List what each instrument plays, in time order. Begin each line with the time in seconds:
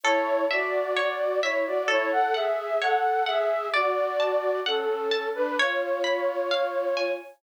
0.03 flute E4 C#5, orchestral harp A4
0.51 flute F#4 D5, orchestral harp E5
0.97 orchestral harp C#5
1.43 flute E4 C#5, orchestral harp E5
1.66 flute F#4 D5
1.88 flute E4 C#5, orchestral harp A4
2.12 flute A4 F#5
2.34 flute G#4 E5, orchestral harp F#5
2.81 flute A4 F#5, orchestral harp C#5
3.26 flute G#4 E5, orchestral harp F#5
3.74 flute F#4 D5, orchestral harp D5
4.20 orchestral harp A5
4.66 flute C#4 A4, orchestral harp F#5
5.11 orchestral harp A5
5.35 flute D4 B4
5.58 flute F4 C#5, orchestral harp C#5
6.04 orchestral harp B5
6.51 orchestral harp F5
6.97 orchestral harp G#5